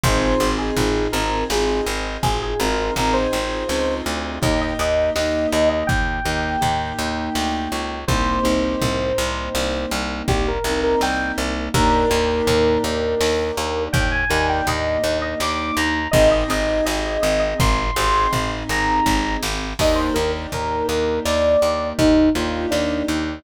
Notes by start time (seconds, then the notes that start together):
0.04 G#1 C4 D#4 F4 G#4 C5, kick, floor tom
0.40 G#1 C4 D#4 F4 G#4
0.58 G#4
0.77 G#1 C4 D#4 F4 G#4, floor tom
1.12 G#1 C4 D#4 F4 G#4 A#4
1.50 G#1 C4 D#4 F4 G#4, snare
1.86 G#1
2.23 G#1 G#4, kick, floor tom
2.43 G#4
2.60 G#1 C4 D#4 F4 G#4 A#4
2.96 G#1 C4 D#4 F4 G#4 A#4, floor tom
3.13 C5
3.32 G#1 C4 D#4 F4 G#4
3.68 C#2 C4 D#4 F4 G#4, snare
4.06 D2
4.42 D#2 A#3 D#4 G4 D#5, kick, floor tom
4.61 D#5
4.79 D#2 A#3 D#4 G4 D#5
5.16 D#2 A#3 D#4 G4 D#5, snare
5.52 D#2 D#5
5.69 D#5
5.87 D#2 G5, kick, floor tom
6.25 D#2 A#3 D#4 G4
6.61 D#2 A#3 D#4 G4, floor tom
6.99 D#2
7.35 D2, snare
7.72 C#2
8.08 C2 A#3 C4 D#4 G4 C5, kick, floor tom
8.43 C2 A#3 C4 D#4 G4
8.82 C2, floor tom
9.18 C2
9.55 C2, snare
9.91 C2
10.28 C2 G4, kick, floor tom
10.48 A#4
10.64 C2 A#3 C4 D#4 G4
10.83 A#4
11.01 C2 G5, snare
11.38 C2
11.74 D#2 A#3 D4 D#4 G4 A#4, kick, floor tom
12.10 D#2 A#3 D4 D#4 G4
12.47 D#2, floor tom
12.84 D#2
13.21 D#2, snare
13.57 D#2
13.93 D#2 G5, kick, floor tom
14.12 G#5
14.29 D#2 A#3 D4 D#4 G4 G#5
14.49 G5
14.67 D#2 D#5, floor tom
15.04 D#2
15.22 D#5
15.40 D#2 D6, snare
15.77 D#2 A#5
16.11 G#1 C4 D#4 G4 G#4 D#5, kick, floor tom
16.31 D#5
16.48 G#1 C4 D#4 G4 G#4 D#5
16.86 G#1 D#5, snare
17.22 G#1 D#5
17.39 D#5
17.60 G#1 C6, kick, floor tom
17.96 G#1 C4 D#4 G4 G#4
18.33 G#1, floor tom
18.69 G#1 A#5
19.06 G#1, kick, snare
19.43 G#1, snare
19.79 D#2 A#3 D4 D#4 G4 D#5, kick, crash
19.96 C5
20.14 D#2 A#3 D4 D#4 G4 A#4
20.52 D#2 A#4, floor tom
20.88 D#2 A#4
21.25 D#2 D5, snare
21.62 D#2
21.99 D#2 D#4, kick, floor tom
22.35 D#2 A#3 D4 D#4 F4 G4
22.71 D#2 D4, snare
23.08 D#2